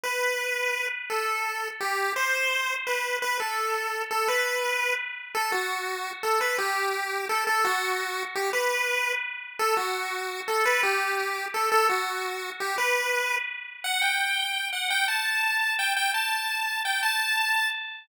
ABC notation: X:1
M:6/8
L:1/8
Q:3/8=113
K:Dmix
V:1 name="Lead 1 (square)"
B5 z | A4 G2 | c4 B2 | B A4 A |
B4 z2 | [K:Amix] A F4 A | B G4 A | A F4 G |
B4 z2 | A F4 A | B G4 A | A F4 G |
B4 z2 | [K:Dmix] f g4 f | g a4 g | g a4 g |
a4 z2 |]